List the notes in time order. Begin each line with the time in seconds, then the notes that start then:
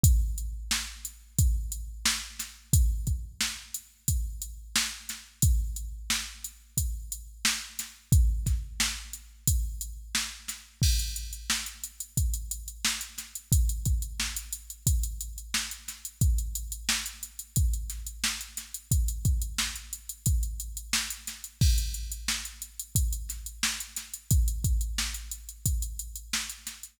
0.04 kick, closed hi-hat
0.38 closed hi-hat
0.71 snare
1.05 closed hi-hat
1.39 kick, closed hi-hat
1.72 closed hi-hat
2.06 snare
2.39 snare, closed hi-hat
2.73 kick, closed hi-hat
3.07 kick, closed hi-hat
3.41 snare
3.74 closed hi-hat
4.08 kick, closed hi-hat
4.42 closed hi-hat
4.76 snare
5.09 snare, closed hi-hat
5.42 kick, closed hi-hat
5.76 closed hi-hat
6.10 snare
6.45 closed hi-hat
6.78 kick, closed hi-hat
7.12 closed hi-hat
7.45 snare
7.79 snare, closed hi-hat
8.12 kick, closed hi-hat
8.46 kick, snare, closed hi-hat
8.80 snare
9.13 closed hi-hat
9.47 kick, closed hi-hat
9.81 closed hi-hat
10.15 snare
10.48 snare, closed hi-hat
10.82 kick, crash
10.99 closed hi-hat
11.16 closed hi-hat
11.33 closed hi-hat
11.50 snare
11.66 closed hi-hat
11.84 closed hi-hat
12.00 closed hi-hat
12.17 kick, closed hi-hat
12.34 closed hi-hat
12.51 closed hi-hat
12.68 closed hi-hat
12.85 snare
13.01 closed hi-hat
13.18 snare, closed hi-hat
13.35 closed hi-hat
13.52 kick, closed hi-hat
13.69 closed hi-hat
13.86 kick, closed hi-hat
14.02 closed hi-hat
14.20 snare
14.37 closed hi-hat
14.53 closed hi-hat
14.70 closed hi-hat
14.87 kick, closed hi-hat
15.04 closed hi-hat
15.21 closed hi-hat
15.38 closed hi-hat
15.54 snare
15.71 closed hi-hat
15.88 snare, closed hi-hat
16.05 closed hi-hat
16.21 kick, closed hi-hat
16.38 closed hi-hat
16.55 closed hi-hat
16.72 closed hi-hat
16.89 snare
17.06 closed hi-hat
17.23 closed hi-hat
17.39 closed hi-hat
17.56 kick, closed hi-hat
17.74 closed hi-hat
17.90 snare, closed hi-hat
18.07 closed hi-hat
18.24 snare
18.41 closed hi-hat
18.57 snare, closed hi-hat
18.74 closed hi-hat
18.91 kick, closed hi-hat
19.08 closed hi-hat
19.25 kick, closed hi-hat
19.42 closed hi-hat
19.58 snare
19.76 closed hi-hat
19.93 closed hi-hat
20.09 closed hi-hat
20.26 kick, closed hi-hat
20.43 closed hi-hat
20.60 closed hi-hat
20.77 closed hi-hat
20.93 snare
21.11 closed hi-hat
21.27 snare, closed hi-hat
21.44 closed hi-hat
21.61 kick, crash
21.78 closed hi-hat
21.94 closed hi-hat
22.12 closed hi-hat
22.28 snare
22.45 closed hi-hat
22.62 closed hi-hat
22.79 closed hi-hat
22.95 kick, closed hi-hat
23.13 closed hi-hat
23.29 snare, closed hi-hat
23.46 closed hi-hat
23.63 snare
23.80 closed hi-hat
23.96 snare, closed hi-hat
24.14 closed hi-hat
24.31 kick, closed hi-hat
24.48 closed hi-hat
24.64 kick, closed hi-hat
24.81 closed hi-hat
24.98 snare
25.14 closed hi-hat
25.31 closed hi-hat
25.49 closed hi-hat
25.66 kick, closed hi-hat
25.82 closed hi-hat
25.99 closed hi-hat
26.16 closed hi-hat
26.33 snare
26.50 closed hi-hat
26.67 snare, closed hi-hat
26.83 closed hi-hat